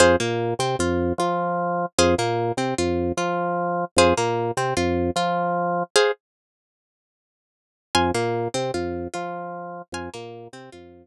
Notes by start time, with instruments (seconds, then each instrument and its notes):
0.00 drawbar organ F2, pizzicato strings G#4 C5 F5
0.20 drawbar organ A#2, pizzicato strings A#3
0.59 drawbar organ C3, pizzicato strings C4
0.79 drawbar organ F2, pizzicato strings F4
1.18 drawbar organ F3, pizzicato strings F4
1.98 drawbar organ F2, pizzicato strings G#4 C5 F5
2.18 drawbar organ A#2, pizzicato strings A#3
2.57 drawbar organ C3, pizzicato strings C4
2.78 drawbar organ F2, pizzicato strings F4
3.17 drawbar organ F3, pizzicato strings F4
3.96 drawbar organ F2, pizzicato strings G#4 C5 F5
4.17 drawbar organ A#2, pizzicato strings A#3
4.57 drawbar organ C3, pizzicato strings C4
4.77 drawbar organ F2, pizzicato strings F4
5.16 drawbar organ F3, pizzicato strings F4
5.96 pizzicato strings G#4 C5 F5
7.95 drawbar organ F2, pizzicato strings G#5 C6 F6
8.14 drawbar organ A#2, pizzicato strings A#3
8.54 drawbar organ C3, pizzicato strings C4
8.74 drawbar organ F2, pizzicato strings F4
9.14 drawbar organ F3, pizzicato strings F4
9.92 drawbar organ F2, pizzicato strings G#5 C6 F6
10.14 drawbar organ A#2, pizzicato strings A#3
10.53 drawbar organ C3, pizzicato strings C4
10.72 drawbar organ F2, pizzicato strings F4